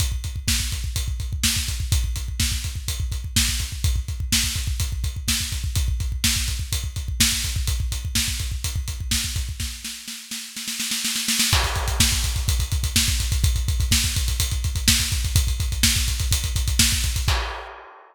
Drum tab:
CC |----------------|----------------|----------------|----------------|
HH |x-x---x-x-x---x-|x-x---x-x-x---x-|x-x---x-x-x---x-|x-x---x-x-x---x-|
SD |----o-------o---|----o-------o---|----o-------o---|----o-------o---|
BD |oooooooooooooooo|oooooooooooooooo|oooooooooooooooo|oooooooooooooooo|

CC |----------------|----------------|x---------------|----------------|
HH |x-x---x-x-x---x-|----------------|-xxx-xxxxxxx-xxx|xxxx-xxxxxxx-xxx|
SD |----o-------o---|o-o-o-o-oooooooo|----o-------o---|----o-------o---|
BD |oooooooooooooooo|o---------------|oooooooooooooooo|oooooooooooooooo|

CC |----------------|x---------------|
HH |xxxx-xxxxxxx-xxx|----------------|
SD |----o-------o---|----------------|
BD |oooooooooooooooo|o---------------|